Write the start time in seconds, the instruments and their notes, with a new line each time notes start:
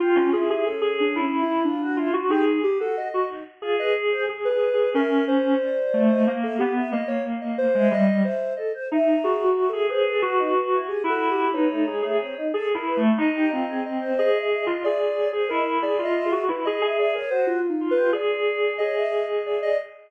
0.00 ocarina F4, clarinet F4, choir aahs G4
0.15 clarinet C#4
0.33 choir aahs E4, clarinet G#4
0.49 ocarina G4, clarinet G#4
0.65 choir aahs C#4, ocarina A4
0.81 clarinet G#4
1.00 ocarina D4
1.16 clarinet E4
1.21 ocarina C#4
1.34 choir aahs E4
1.42 ocarina E4
1.65 ocarina D4, choir aahs F4
1.82 choir aahs F#4
1.97 choir aahs E4, clarinet F4
2.13 clarinet F#4
2.29 ocarina D#4, choir aahs G4, clarinet G#4
2.63 ocarina G4
2.79 choir aahs F#4, ocarina A4
2.97 ocarina D#5
3.14 clarinet F#4
3.28 choir aahs D#4
3.61 choir aahs F4, clarinet G#4
3.79 choir aahs B4, ocarina D#5
4.10 choir aahs C5
4.27 ocarina G#4, clarinet G#4
4.45 ocarina B4
4.50 clarinet G#4
4.73 clarinet G#4
4.94 clarinet C#4, ocarina A#4, choir aahs E5
5.28 ocarina C5
5.60 choir aahs D5
5.94 clarinet A3
6.10 choir aahs D#5
6.27 clarinet A#3
6.42 ocarina A4, choir aahs E5
6.58 clarinet B3, ocarina G4
6.75 choir aahs E5
6.92 clarinet A#3, ocarina D#5
7.08 ocarina C#5
7.41 ocarina D#5
7.58 ocarina C5
7.75 clarinet G#3, choir aahs E5
7.91 clarinet G3, ocarina D#5
8.23 ocarina C5, choir aahs E5
8.56 choir aahs A4, ocarina D#5
8.74 choir aahs C5
8.91 clarinet D#4, choir aahs E5
9.24 clarinet F#4, ocarina G#4
9.44 ocarina F#4
9.56 choir aahs E5
9.69 ocarina A4, choir aahs E5
9.73 clarinet G#4
9.89 clarinet G#4, ocarina B4, choir aahs C5
10.06 choir aahs A4
10.22 clarinet F#4, choir aahs F#4
10.38 choir aahs D#4
10.72 choir aahs E4
10.88 ocarina G4, choir aahs G#4
11.03 clarinet E4, choir aahs F#4
11.10 ocarina A4
11.31 ocarina G4
11.53 choir aahs B3, clarinet D#4, ocarina C#5
11.70 choir aahs A3
11.86 choir aahs G#3, clarinet G#4
12.02 choir aahs A3, clarinet G#4
12.20 choir aahs C4
12.37 choir aahs D#4
12.54 clarinet G#4, choir aahs A4
12.71 clarinet E4, choir aahs A#4
12.86 choir aahs B4
12.97 clarinet A3
13.18 clarinet D#4, ocarina D#5
13.35 choir aahs G4
13.50 clarinet C4, choir aahs F4, ocarina D#5
13.69 choir aahs G#4
13.86 ocarina D#5
14.00 choir aahs C5
14.18 clarinet G#4, ocarina D#5
14.34 choir aahs E5
14.39 ocarina D#5
14.50 choir aahs E5
14.62 ocarina D#5
14.66 clarinet F4
14.83 clarinet G#4, ocarina D5, choir aahs E5
15.17 choir aahs C#5
15.33 clarinet G#4, choir aahs C5
15.49 clarinet E4, ocarina A#4, choir aahs D#5
15.82 clarinet G#4, ocarina D5
15.99 clarinet F4, choir aahs E5
16.05 ocarina D#5
16.14 choir aahs E5
16.25 ocarina G#4
16.32 clarinet F#4
16.48 clarinet E4, ocarina B4
16.65 clarinet G#4, ocarina D#5
16.81 clarinet G#4, ocarina D#5, choir aahs E5
16.98 clarinet G#4, ocarina D5, choir aahs E5
17.15 ocarina A#4, choir aahs C#5
17.30 choir aahs F#4, ocarina C5
17.47 ocarina F4
17.62 choir aahs F4
17.70 ocarina D#4
17.81 clarinet F4
17.91 ocarina B4
17.96 choir aahs G4
18.13 clarinet G#4, ocarina D5
18.78 clarinet G#4, choir aahs C#5, ocarina D#5
18.96 choir aahs E5
19.12 ocarina D#5
19.45 ocarina D5, choir aahs E5
19.62 choir aahs D5, ocarina D#5